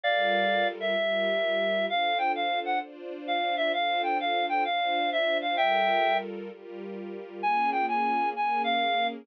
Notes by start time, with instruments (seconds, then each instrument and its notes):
0.04 string ensemble 1 G3 F4 A4 A#4, clarinet D5 F5
0.80 clarinet E5
0.96 string ensemble 1 G3 F4 G4 A#4
1.89 string ensemble 1 D4 F4 A4 C5, clarinet F5
2.18 clarinet G5
2.35 clarinet F5
2.65 clarinet F#5
2.81 string ensemble 1 D4 F4 C5 D5
3.27 clarinet F5
3.57 clarinet E5
3.73 string ensemble 1 D4 F4 A4 C5, clarinet F5
4.03 clarinet G5
4.20 clarinet F5
4.49 clarinet G5
4.65 string ensemble 1 D4 F4 C5 D5, clarinet F5
5.12 clarinet E5
5.42 clarinet F5
5.57 string ensemble 1 G3 F4 A4 A#4, clarinet E5 G5
6.50 string ensemble 1 G3 F4 G4 A#4
7.42 string ensemble 1 A#3 C#4 F4 G#4, clarinet G#5
7.72 clarinet G5
7.88 clarinet G#5
8.35 string ensemble 1 A#3 C#4 G#4 A#4, clarinet G#5
8.64 clarinet F5